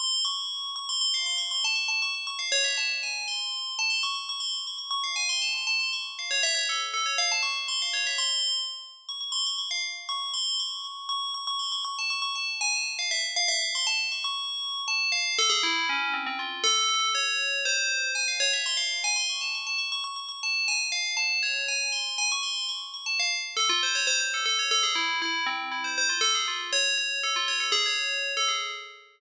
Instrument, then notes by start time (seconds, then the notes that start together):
tubular bells
0.00 C6
0.25 C#6
0.76 C#6
0.89 C6
1.01 C6
1.14 F5
1.26 C6
1.38 C#6
1.51 C6
1.64 A5
1.76 C#6
1.88 A5
2.02 C#6
2.15 C#6
2.27 C#6
2.39 F5
2.52 C#5
2.64 E5
2.77 A5
3.03 G#5
3.28 C6
3.79 A5
3.90 C6
4.03 C#6
4.16 C#6
4.29 C#6
4.40 C6
4.67 C#6
4.78 C#6
4.91 C#6
5.04 F5
5.16 G#5
5.29 C6
5.42 A5
5.54 C6
5.67 A5
5.80 C6
5.93 C#6
6.19 F5
6.31 C#5
6.43 E5
6.55 C#5
6.69 A4
6.94 A4
7.06 C#5
7.18 F5
7.32 A5
7.43 C#6
7.56 C#6
7.68 C6
7.82 F5
7.93 C#5
8.07 E5
8.18 C6
9.09 C#6
9.21 C#6
9.32 C6
9.46 C#6
9.58 C#6
9.71 F5
10.09 C#6
10.34 C6
10.60 C#6
10.84 C#6
11.09 C#6
11.34 C#6
11.47 C#6
11.59 C6
11.72 C#6
11.85 C#6
11.99 A5
12.10 C#6
12.22 C#6
12.36 A5
12.61 G#5
12.73 A5
12.99 F5
13.11 E5
13.36 F5
13.48 E5
13.62 F5
13.75 C6
13.87 A5
14.12 C#6
14.24 C#6
14.88 A5
15.12 F5
15.39 A4
15.50 G#4
15.63 E4
15.89 C#4
16.14 C4
16.26 C4
16.39 F4
16.64 A4
17.15 C#5
17.65 C5
18.15 G#5
18.28 F5
18.40 C#5
18.53 E5
18.66 C6
18.77 F5
19.04 G#5
19.16 C6
19.29 C#6
19.41 A5
19.55 C#6
19.67 A5
19.78 C#6
19.92 C#6
20.04 C#6
20.16 C#6
20.29 C#6
20.43 A5
20.68 G#5
20.92 F5
21.17 A5
21.43 C#5
21.68 G#5
21.92 C6
22.18 G#5
22.32 C#6
22.43 C6
22.69 C#6
22.94 C#6
23.06 A5
23.19 F5
23.57 A4
23.69 F4
23.83 C5
23.95 C#5
24.07 C5
24.20 C5
24.34 A4
24.46 A4
24.59 C#5
24.71 A4
24.83 G#4
24.95 E4
25.22 E4
25.46 C4
25.71 E4
25.84 C5
25.98 C5
26.09 F4
26.21 A4
26.35 G#4
26.48 F4
26.73 C#5
26.98 C#5
27.23 A4
27.36 F4
27.48 C#5
27.60 A4
27.72 G#4
27.86 C#5
28.37 A4
28.48 G#4